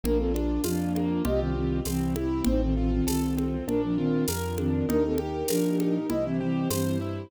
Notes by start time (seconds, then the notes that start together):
0.03 A#1 A#3 D4 F4 A#4, low conga
0.18 C4 A4
0.34 D4, high conga
0.64 F2 F3 D4 F4, tambourine, high conga
0.95 A#3, high conga
1.25 C2 C4 F4 G4 D#5, low conga
1.40 D#3 C4
1.56 D#3 C4
1.85 C2 E3 C4 E4 G4, tambourine, high conga
2.16 E4, high conga
2.44 A1 C4 D#4 F4 A4 C5, low conga
2.63 D#3 C4
2.77 D#3 C4 F4
2.92 D#3 C4
3.07 C2 D#3 C4 A4, tambourine, high conga
3.37 C4, high conga
3.67 A#1 D4 F4 A#4, low conga
3.83 F3 D4
3.97 D#3 C4 F4
4.28 F2 A#4, tambourine, high conga
4.58 D#3 C4 D4, high conga
4.89 D#2 D4 D#4 G4 A#4, low conga
5.05 C4 A4
5.18 G4, high conga
5.48 A#2 F3 D4 A#4, tambourine, high conga
5.80 D#4, high conga
6.10 C2 E4 G4 C5 D#5, low conga
6.25 E3 C4
6.40 E3 C4 G4
6.70 G2 E3 C4 C5, tambourine, high conga
7.01 E4